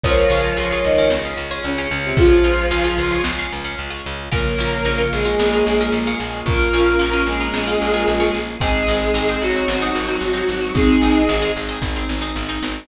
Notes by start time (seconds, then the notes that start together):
0.03 C#2 F3 G#3 C#4 F4 G#4 A#4 C#5, kick, closed hi-hat
0.30 C#2 C#4 F4 G#4, closed hi-hat
0.56 C#2 C#4 F4 G#4, closed hi-hat
0.72 C#4 F4 G#4
0.84 C#2 D#3 D#4, closed hi-hat
0.98 C#4 F4 G#4
1.10 C#2 G#4, snare
1.25 C#4 F4 G#4
1.37 C#2, closed hi-hat
1.51 C#4 F4 G#4
1.63 C#2 C#3 C#4 C#5, closed hi-hat
1.78 C#4 F4 G#4
1.91 C#2, closed hi-hat
2.05 C3 C4
2.17 C#2 F3 F4 G#4, kick, closed hi-hat
2.44 C#2 C#4 F4 G#4, closed hi-hat
2.71 C#2 C#4 F4 G#4, closed hi-hat
2.84 C#4 F4 G#4
2.98 C#2, closed hi-hat
3.11 C#4 F4 G#4
3.24 C#2 G#3, snare
3.39 C#4 F4 G#4
3.52 C#2, closed hi-hat
3.65 C#4 F4 G#4
3.78 C#2, closed hi-hat
3.90 C#4 F4 G#4
4.06 C#2, closed hi-hat
4.32 A#1 C#3 F3 A#3 C#4 F4 A#4, kick, closed hi-hat
4.58 A#1 C#4 F4 A#4, closed hi-hat
4.85 A#1 C#4 F4 A#4, closed hi-hat
4.98 C#4 F4 A#4
5.13 A#1 G#3 G#4, closed hi-hat
5.25 C#4 F4 A#4
5.39 A#1 A#3, snare
5.53 C#4 F4 A#4
5.66 A#1, closed hi-hat
5.81 C#4 F4 A#4
5.92 A#1, closed hi-hat
6.07 C#4 F4 A#4
6.20 A#1, closed hi-hat
6.46 A#1 A#3 C#4 F4 A#4, kick, closed hi-hat
6.73 A#1 C#4 F4 A#4, closed hi-hat
6.99 A#1 C#4 F4 A#4, closed hi-hat
7.13 C#4 F4 A#4
7.27 A#1 G#3 G#4, closed hi-hat
7.40 C#4 F4 A#4
7.53 A#1, snare
7.67 C#4 F4 A#4
7.81 A#1, closed hi-hat
7.94 C#4 F4 A#4
8.07 A#1, closed hi-hat
8.20 C#4 F4 A#4
8.34 A#1, closed hi-hat
8.60 G#1 G#3 C4 D#4 G#4, kick, closed hi-hat
8.87 G#1 C4 D#4 G#4, closed hi-hat
9.14 G#1 C4 D#4 G#4, closed hi-hat
9.29 C4 D#4 G#4
9.42 G#1 F#3 F#4, closed hi-hat
9.55 C4 D#4 G#4
9.68 G#1, snare
9.82 C4 D#4 G#4
9.95 G#1, closed hi-hat
10.08 C4 D#4 G#4
10.21 G#1, closed hi-hat
10.33 C4 D#4 G#4
10.48 G#1, closed hi-hat
10.74 G#1 G#3 C4 D#4 G#4, kick, closed hi-hat
11.01 G#1 C4 D#4 G#4, closed hi-hat
11.28 G#1 C4 D#4 G#4, closed hi-hat
11.42 C4 D#4 G#4
11.55 G#1, closed hi-hat
11.69 C4 D#4 G#4
11.82 G#1, kick, snare
11.96 C4 D#4 G#4
12.09 G#1, snare
12.21 C4 D#4 G#4
12.36 G#1, snare
12.49 C4 D#4 G#4
12.62 G#1, snare